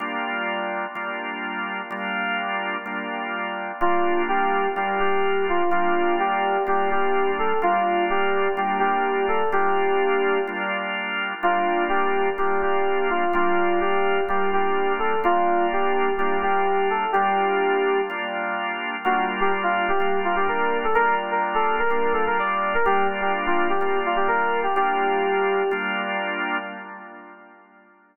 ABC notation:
X:1
M:4/4
L:1/16
Q:1/4=126
K:Gm
V:1 name="Electric Piano 2"
z16 | z16 | F4 G4 G2 G4 F2 | F4 G4 G2 G4 A2 |
F4 G4 G2 G4 A2 | G8 z8 | F4 G4 G2 G4 F2 | F4 G4 G2 G4 A2 |
F4 G4 G2 G4 A2 | G8 z8 | ^F2 z G z =F2 G3 F G B3 A | B2 z B z A2 B3 A B d3 B |
G2 z G z F2 G3 F G B3 G | G10 z6 |]
V:2 name="Drawbar Organ"
[G,B,DF]8 [G,B,DF]8 | [G,B,DF]8 [G,B,DF]8 | [G,B,DF]8 [G,B,DF]8 | [G,B,DF]8 [G,B,DF]8 |
[G,B,DF]8 [G,B,DF]8 | [G,B,DF]8 [G,B,DF]8 | [G,B,DF]8 [G,B,DF]8 | [G,B,DF]8 [G,B,DF]8 |
[G,B,DF]8 [G,B,DF]8 | [G,B,DF]8 [G,B,DF]8 | [G,B,DF]8 [G,B,DF]8 | [G,B,DF]8 [G,B,DF]8 |
[G,B,DF]8 [G,B,DF]8 | [G,B,DF]8 [G,B,DF]8 |]